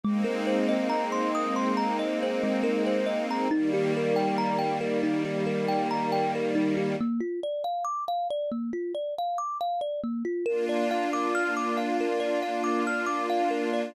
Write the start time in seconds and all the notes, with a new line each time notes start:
0.03 G#3 A#3 C4 D#4
0.24 A#4
0.47 C5
0.69 D#5
0.89 A#5
1.12 C6
1.35 D#6
1.56 C6
1.77 A#5
1.99 D#5
2.23 C5
2.43 G#3
2.63 A#4
2.86 C5
3.06 D#5
3.31 A#5
3.51 D#3 G3 A#3 D#4
3.73 G4
3.97 A#4
4.16 G5
4.38 A#5
4.59 G5
4.81 A#4
5.03 D#4
5.25 G4
5.46 A#4
5.68 G5
5.91 A#5
6.12 G5
6.35 A#4
6.55 D#4
6.77 G4
7.01 A#3
7.20 F4
7.43 D5
7.64 F5
7.85 D6
8.08 F5
8.30 D5
8.52 A#3
8.73 F4
8.95 D5
9.18 F5
9.38 D6
9.61 F5
9.81 D5
10.03 A#3
10.25 F4
10.46 A#3 D4 F4 A#4
10.69 D5
10.91 F5
11.13 D6
11.35 F6
11.57 D6
11.77 F5
12.01 A#4
12.20 D5
12.42 F5
12.64 D6
12.87 F6
13.06 D6
13.30 F5
13.51 A#4
13.73 D5